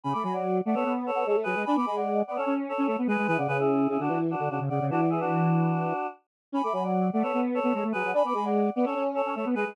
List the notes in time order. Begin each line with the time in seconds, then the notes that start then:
0.04 C#3 G#5 B5
0.13 A3 B5 D6
0.23 F#3 G#5 B5
0.33 D5 F#5
0.65 A3 D5 F#5
0.74 B3 A4 C#5
0.85 B3
1.06 A4 C#5
1.15 B3
1.26 G#3 A4 C#5
1.35 A3
1.43 F#3 G#4 B4
1.55 G#3
1.65 D4 G#5 B5
1.76 B3 B5 D6
1.86 G#3 G#5 B5
1.96 D5 F#5
2.27 B3 D5 F#5
2.36 C#4 A4 C#5
2.46 C#4
2.69 A4 C#5
2.78 C#4
2.87 A3 A4 C#5
2.98 B3
3.07 G#3 G#4 B4
3.18 G#3
3.27 E3 G#4 B4
3.37 C#3 D5 F#5
3.48 C#3 G#4 B4
3.59 E4 G#4
3.88 C#3 E4 G#4
3.99 D3 D4 F#4
4.09 E3
4.31 D4 F#4
4.39 D3
4.50 C#3 D4 F#4
4.60 C#3
4.69 C#3 D5 F#5
4.81 C#3
4.90 E3 D4 F#4
5.00 D5 F#5
5.10 E4 G#4
5.20 D4 F#4
6.52 C#4 G#5 B5
6.63 A3 B5 D6
6.72 F#3 G#5 B5
6.83 D5 F#5
7.13 A3 D5 F#5
7.23 B3 A4 C#5
7.33 B3
7.54 A4 C#5
7.63 B3
7.74 G#3 A4 C#5
7.83 A3
7.92 F#3 G#4 B4
8.04 F#3
8.13 D4 G#5 B5
8.24 B3 B5 D6
8.34 G#3 G#5 B5
8.45 D5 F#5
8.75 B3 D5 F#5
8.85 C#4 A4 C#5
8.95 C#4
9.15 A4 C#5
9.26 C#4
9.35 A3 A4 C#5
9.45 B3
9.55 G#3 G#4 B4
9.66 G#3